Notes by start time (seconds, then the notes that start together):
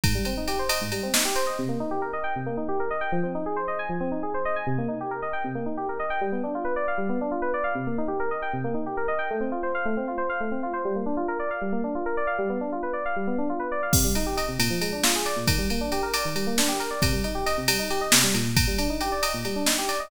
0.04 G#2, kick, ride
0.15 G3
0.25 C4, ride
0.37 D#4
0.48 G4, ride
0.59 C5
0.69 D#5, ride
0.81 G#2
0.92 G3, ride
1.03 C4
1.14 D#4, snare
1.25 G4
1.35 C5, ride
1.47 D#5
1.59 C3
1.68 A#3
1.80 D#4
1.91 G4
2.02 A#4
2.13 D#5
2.24 G5
2.36 C3
2.46 A#3
2.57 D#4
2.68 G4
2.80 A#4
2.90 D#5
3.01 G5
3.12 F3
3.23 C4
3.35 D#4
3.46 G#4
3.56 C5
3.68 D#5
3.79 G#5
3.89 F3
4.00 C4
4.11 D#4
4.23 G#4
4.34 C5
4.45 D#5
4.56 G#5
4.67 C3
4.78 A#3
4.88 D#4
5.01 G4
5.11 A#4
5.22 D#5
5.33 G5
5.44 C3
5.55 A#3
5.66 D#4
5.77 G4
5.89 A#4
5.99 D#5
6.10 G5
6.21 G3
6.32 B3
6.43 D4
6.55 F4
6.65 B4
6.76 D5
6.88 F5
6.98 G3
7.09 B3
7.21 D4
7.31 F4
7.42 B4
7.54 D5
7.64 F5
7.75 C3
7.87 A#3
7.98 D#4
8.08 G4
8.20 A#4
8.31 D#5
8.42 G5
8.53 C3
8.64 A#3
8.74 D#4
8.86 G4
8.97 A#4
9.08 D#5
9.19 G5
9.30 A3
9.40 C4
9.52 F4
9.63 C5
9.75 F5
9.85 A3
9.97 C4
10.08 F4
10.18 C5
10.29 F5
10.40 A3
10.51 C4
10.63 F4
10.73 C5
10.85 G3
10.96 A#3
11.06 D4
11.17 F4
11.28 A#4
11.39 D5
11.51 F5
11.61 G3
11.72 A#3
11.84 D4
11.95 F4
12.06 A#4
12.17 D5
12.27 F5
12.38 G3
12.49 B3
12.61 D4
12.72 F4
12.83 B4
12.93 D5
13.05 F5
13.16 G3
13.27 B3
13.38 D4
13.49 F4
13.59 B4
13.72 D5
13.83 F5
13.93 C3, kick, crash
14.04 G3
14.15 D#4, ride
14.26 G4
14.37 D#5, ride
14.48 C3
14.59 A#2, ride
14.70 F3
14.81 G#3, ride
14.92 D4
15.03 F4, snare
15.15 G#4
15.25 D5, ride
15.36 A#2
15.47 D#3, kick, ride
15.58 G3
15.70 A#3, ride
15.81 D4
15.92 G4, ride
16.03 A#4
16.14 D5, ride
16.25 D#3
16.35 G3, ride
16.47 A#3
16.58 D4, snare
16.68 G4
16.80 A#4, ride
16.91 D5
17.02 C3, kick, ride
17.13 G3
17.24 D#4, ride
17.35 G4
17.46 D#5, ride
17.57 C3
17.68 G3, ride
17.79 D#4
17.90 G4, ride
18.01 D#5
18.12 C3, snare
18.23 G3
18.34 A#2, ride
18.57 kick, ride
18.67 G3
18.78 D4, ride
18.90 D#4
19.01 G4, ride
19.12 D5
19.22 D#5, ride
19.34 A#2
19.45 G3, ride
19.56 D4
19.66 D#4, snare
19.78 G4
19.88 D5, ride
20.00 D#5